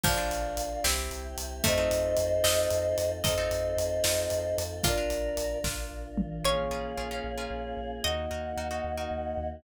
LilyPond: <<
  \new Staff \with { instrumentName = "Choir Aahs" } { \time 6/8 \key bes \major \tempo 4. = 75 <d'' f''>4. r4. | <c'' ees''>2. | <c'' ees''>2. | <bes' d''>4. r4. |
\key bes \minor <des'' f''>2. | <ees'' ges''>2. | }
  \new Staff \with { instrumentName = "Harpsichord" } { \time 6/8 \key bes \major f4. c'4. | a4. ees''4. | ees''2~ ees''8 r8 | f'4. r4. |
\key bes \minor des''2. | ees''2. | }
  \new Staff \with { instrumentName = "Orchestral Harp" } { \time 6/8 \key bes \major <d' f' bes'>16 <d' f' bes'>4~ <d' f' bes'>16 <c' e' g'>4. | <c' ees' f' a'>16 <c' ees' f' a'>4~ <c' ees' f' a'>16 <c' ees' f' a'>4. | <c' ees' f' a'>16 <c' ees' f' a'>4~ <c' ees' f' a'>16 <c' ees' f' a'>4. | <d' f' bes'>16 <d' f' bes'>4~ <d' f' bes'>16 <d' f' bes'>4. |
\key bes \minor <des' f' aes' bes'>8 <des' f' aes' bes'>8 <des' f' aes' bes'>16 <des' f' aes' bes'>8 <des' f' aes' bes'>4~ <des' f' aes' bes'>16 | <ees' ges' bes'>8 <ees' ges' bes'>8 <ees' ges' bes'>16 <ees' ges' bes'>8 <ees' ges' bes'>4~ <ees' ges' bes'>16 | }
  \new Staff \with { instrumentName = "Synth Bass 2" } { \clef bass \time 6/8 \key bes \major bes,,8 bes,,8 bes,,8 c,8 c,8 c,8 | f,8 f,8 f,8 f,8 f,8 f,8 | f,8 f,8 f,8 f,8 f,8 f,8 | bes,,8 bes,,8 bes,,8 bes,,8 bes,,8 bes,,8 |
\key bes \minor bes,,8 bes,,8 bes,,8 bes,,8 bes,,8 bes,,8 | ees,8 ees,8 ees,8 ees,8 ees,8 ees,8 | }
  \new Staff \with { instrumentName = "Choir Aahs" } { \time 6/8 \key bes \major <d' f' bes'>4. <c' e' g'>4. | <c' ees' f' a'>2. | <c' ees' f' a'>2. | <d' f' bes'>2. |
\key bes \minor <bes des' f' aes'>2. | <bes ees' ges'>2. | }
  \new DrumStaff \with { instrumentName = "Drums" } \drummode { \time 6/8 <cymc bd>8 hh8 hh8 sn8 hh8 hh8 | <hh bd>8 hh8 hh8 sn8 hh8 hh8 | <hh bd>8 hh8 hh8 sn8 hh8 hh8 | <hh bd>8 hh8 hh8 <bd sn>4 toml8 |
r4. r4. | r4. r4. | }
>>